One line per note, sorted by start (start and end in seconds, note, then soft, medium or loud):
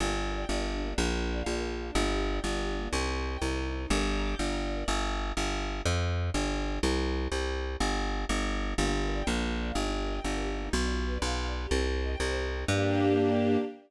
0.00 0.45 G1 medium
0.00 0.08 A#3 medium
0.08 0.15 D4 medium
0.16 0.24 G4 medium
0.25 0.32 A#4 medium
0.33 0.40 D5 medium
0.40 0.48 G5 medium
0.49 0.94 G1 medium
0.49 0.56 D5 medium
0.57 0.64 A#4 medium
0.65 0.72 G4 medium
0.73 0.81 D4 medium
0.81 0.89 A#3 medium
0.89 0.97 D4 medium
0.98 1.43 A#1 medium
0.98 1.05 A#3 loud
1.06 1.13 D4 medium
1.14 1.21 F4 medium
1.22 1.29 A#4 medium
1.30 1.38 D5 medium
1.38 1.46 F5 medium
1.46 1.91 A#1 medium
1.46 1.54 D5 medium
1.55 1.62 A#4 medium
1.62 1.70 F4 medium
1.71 1.78 D4 medium
1.79 1.86 A#3 medium
1.87 1.94 D4 medium
1.95 2.40 G1 medium
1.95 2.02 A#3 loud
2.04 2.11 D4 medium
2.11 2.19 G4 medium
2.20 2.27 A#4 medium
2.28 2.35 D5 medium
2.36 2.43 G5 medium
2.44 2.89 G1 medium
2.44 2.51 D5 medium
2.52 2.59 A#4 medium
2.60 2.68 G4 medium
2.68 2.76 D4 medium
2.77 2.84 A#3 medium
2.85 2.92 D4 medium
2.93 3.37 C2 medium
2.93 3.00 C4 loud
3.01 3.08 D#4 medium
3.09 3.16 G4 medium
3.17 3.25 C5 medium
3.25 3.33 D#5 medium
3.33 3.40 G5 medium
3.41 3.86 C2 medium
3.41 3.49 D#5 medium
3.50 3.57 C5 medium
3.58 3.65 G4 medium
3.66 3.73 D#4 medium
3.74 3.81 C4 medium
3.82 3.89 D#4 medium
3.90 4.35 G1 loud
3.90 3.98 A#4 medium
3.98 4.06 D5 medium
4.06 4.14 G5 medium
4.15 4.22 A#5 medium
4.23 4.30 D6 medium
4.31 4.38 G6 medium
4.39 4.84 G1 medium
4.39 4.47 D6 medium
4.47 4.55 A#5 medium
4.55 4.62 G5 medium
4.64 4.71 D5 medium
4.72 4.79 A#4 medium
4.79 4.87 D5 medium
4.88 5.33 G1 medium
5.37 5.82 G1 medium
5.86 6.30 F2 medium
6.34 6.79 G1 medium
6.83 7.28 C2 loud
7.32 7.76 C2 medium
7.80 8.25 G1 medium
8.29 8.74 G1 medium
8.78 9.23 G1 medium
8.78 8.85 A#3 loud
8.86 8.94 D4 medium
8.94 9.02 G4 medium
9.02 9.10 A#4 medium
9.11 9.18 D5 medium
9.19 9.26 G5 medium
9.27 9.72 A#1 medium
9.27 9.34 A#3 loud
9.35 9.42 D4 medium
9.43 9.51 F4 medium
9.51 9.59 A#4 medium
9.59 9.67 D5 medium
9.67 9.75 F5 medium
9.75 10.20 G1 medium
9.75 9.83 A#3 loud
9.84 9.91 D#4 medium
9.92 9.99 G4 medium
10.00 10.07 A#4 medium
10.08 10.16 D#5 medium
10.16 10.24 G5 medium
10.24 10.69 G1 medium
10.24 10.32 D#5 loud
10.33 10.40 A#4 medium
10.41 10.48 G4 medium
10.49 10.56 D#4 medium
10.57 10.64 A#3 medium
10.65 10.72 D#4 medium
10.73 11.18 B1 medium
10.73 10.80 B3 loud
10.81 10.88 D4 medium
10.89 10.97 F4 medium
10.98 11.05 G4 medium
11.06 11.13 B4 medium
11.14 11.21 D5 medium
11.22 11.67 B1 medium
11.22 11.29 F5 medium
11.30 11.38 G5 medium
11.38 11.46 F5 medium
11.46 11.53 D5 medium
11.55 11.62 B4 medium
11.63 11.70 G4 medium
11.71 12.16 C2 medium
11.71 11.78 C4 loud
11.79 11.86 D#4 medium
11.87 11.94 G4 medium
11.95 12.02 C5 medium
12.03 12.10 D#5 medium
12.11 12.19 G5 medium
12.20 12.65 C2 medium
12.20 12.27 D#5 medium
12.28 12.35 C5 medium
12.36 12.43 G4 medium
12.44 12.51 D#4 medium
12.52 12.59 C4 medium
12.60 12.67 D#4 medium
12.68 13.57 G2 loud
12.68 13.57 A#3 loud
12.68 13.57 D4 loud
12.68 13.57 G4 loud